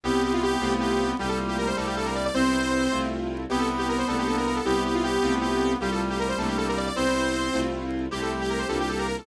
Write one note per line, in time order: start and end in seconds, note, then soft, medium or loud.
0.04 0.57 C2 loud
0.04 0.56 G3 medium
0.04 0.56 B3 medium
0.04 1.16 B3 medium
0.04 0.56 C4 loud
0.04 0.56 E4 medium
0.04 0.23 G4 medium
0.24 0.33 G4 medium
0.33 0.42 F4 medium
0.43 0.74 G4 loud
0.60 1.14 C2 loud
0.60 1.13 A3 loud
0.60 1.13 C4 loud
0.60 1.13 E4 medium
0.60 1.13 F4 loud
0.80 1.11 G4 medium
1.19 1.73 C2 loud
1.19 2.27 G3 loud
1.19 1.71 G3 medium
1.19 1.71 A3 medium
1.19 1.71 A#3 medium
1.19 1.71 F4 medium
1.19 1.29 G4 medium
1.29 1.38 A4 medium
1.48 1.57 G4 medium
1.58 1.67 A#4 medium
1.67 1.76 C5 medium
1.77 2.30 C2 loud
1.77 2.29 A3 loud
1.77 2.29 A#3 loud
1.77 2.29 C4 loud
1.77 2.29 D4 loud
1.77 1.86 A4 medium
1.86 1.95 G4 medium
1.97 2.06 A4 medium
2.06 2.15 A#4 medium
2.15 2.24 D5 medium
2.25 2.34 D5 medium
2.34 2.88 C2 loud
2.34 2.86 G3 medium
2.34 2.86 B3 loud
2.34 2.86 C4 loud
2.34 3.06 C4 loud
2.34 2.86 E4 medium
2.34 2.98 C5 loud
2.92 3.46 C2 loud
2.92 3.44 A3 medium
2.92 3.44 C4 medium
2.92 3.44 E4 medium
2.92 3.44 F4 medium
3.50 4.04 C2 loud
3.50 4.02 B3 medium
3.50 4.60 B3 loud
3.50 4.02 C4 medium
3.50 4.02 E4 medium
3.50 4.02 G4 loud
3.50 3.59 G4 medium
3.59 3.68 A4 medium
3.78 3.87 G4 medium
3.89 3.98 A#4 medium
3.98 4.07 C5 medium
4.08 4.61 C2 loud
4.08 4.60 A3 loud
4.08 4.60 A#3 loud
4.08 4.60 C4 loud
4.08 4.60 D4 medium
4.08 4.17 A4 medium
4.18 4.27 G4 medium
4.27 4.36 A4 medium
4.37 4.46 A#4 medium
4.46 4.55 A#4 medium
4.56 4.65 A4 medium
4.65 5.18 C2 loud
4.65 5.17 G3 medium
4.65 5.17 B3 medium
4.65 5.78 B3 medium
4.65 5.17 C4 loud
4.65 5.17 E4 medium
4.65 4.83 G4 medium
4.85 4.94 G4 medium
4.94 5.03 F4 medium
5.03 5.34 G4 loud
5.23 5.76 C2 loud
5.23 5.75 A3 loud
5.23 5.75 C4 loud
5.23 5.75 E4 medium
5.23 5.75 F4 loud
5.41 5.72 G4 medium
5.80 6.33 C2 loud
5.80 6.89 G3 loud
5.80 6.33 G3 medium
5.80 6.33 A3 medium
5.80 6.33 A#3 medium
5.80 6.33 F4 medium
5.80 5.90 G4 medium
5.92 6.01 A4 medium
6.10 6.19 G4 medium
6.19 6.28 A#4 medium
6.29 6.38 C5 medium
6.38 6.91 C2 loud
6.38 6.90 A3 loud
6.38 6.90 A#3 loud
6.38 6.90 C4 loud
6.38 6.90 D4 loud
6.38 6.48 A4 medium
6.48 6.57 G4 medium
6.58 6.67 A4 medium
6.68 6.77 A#4 medium
6.77 6.86 D5 medium
6.86 6.95 D5 medium
6.96 7.50 C2 loud
6.96 7.48 G3 medium
6.96 7.48 B3 loud
6.96 7.48 C4 loud
6.96 7.67 C4 loud
6.96 7.48 E4 medium
6.96 7.60 C5 loud
7.54 8.08 C2 loud
7.54 8.06 A3 medium
7.54 8.06 C4 medium
7.54 8.06 E4 medium
7.54 8.06 F4 medium
8.11 8.65 C2 loud
8.11 8.63 G3 medium
8.11 8.63 A3 medium
8.11 8.63 C4 loud
8.11 8.63 E4 loud
8.11 8.21 G4 medium
8.11 9.06 G4 loud
8.22 8.31 A4 medium
8.41 8.50 G4 medium
8.50 8.59 A#4 medium
8.59 8.68 C5 medium
8.69 9.22 C2 loud
8.69 9.21 G3 loud
8.69 9.21 A#3 medium
8.69 9.21 D4 loud
8.69 9.21 F4 medium
8.69 8.78 A4 medium
8.80 8.89 G4 medium
8.89 8.98 A4 medium
8.98 9.07 A#4 medium
9.07 9.16 A#4 medium
9.18 9.26 A4 medium